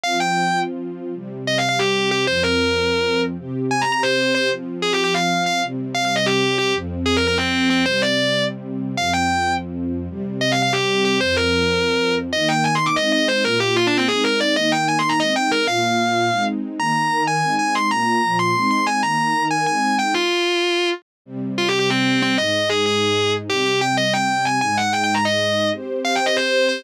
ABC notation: X:1
M:7/8
L:1/8
Q:1/4=188
K:Cm
V:1 name="Distortion Guitar"
f g3 z3 | z2 (3e f f G2 G | c B5 z | z2 (3a b b c2 c |
z2 (3A G G f2 f | z2 (3f f e G2 G | z2 (3A B B C2 C | c d3 z3 |
f g3 z3 | z2 (3e f f G2 G | c B5 z | [K:Eb] e g (3a c' d' e e c |
B G (3F D C A B d | e g (3a c' b e g B | f5 z2 | b3 a2 a c' |
b3 c'2 c' a | b3 a a2 g | F5 z2 | [K:Cm] z2 (3F G G C2 C |
e2 A A3 z | G G g e g2 a | a ^f (3g g b e3 | z2 (3f g e c2 c |]
V:2 name="String Ensemble 1"
[F,CF]7 | [C,G,C]7 | [F,,F,C]7 | [C,CG]7 |
[F,CF]7 | [C,G,C]7 | [F,,F,C]7 | [C,G,C]7 |
[F,,F,C]7 | [C,G,C]7 | [F,,F,C]7 | [K:Eb] [E,B,E]4 [A,CE]3 |
[B,,B,F]4 [A,CE]3 | [E,B,E]4 [A,CE]3 | [B,,B,F]4 [A,CE]3 | [E,B,E]2 [E,EB]2 [A,CE]3 |
[B,,B,F]2 [B,,F,F]2 [A,CE]3 | [E,B,E]2 [E,EB]2 [A,CE]3 | z7 | [K:Cm] [C,G,C]7 |
[A,,A,E]7 | [C,G,C]7 | [A,,A,E]7 | [CGc]7 |]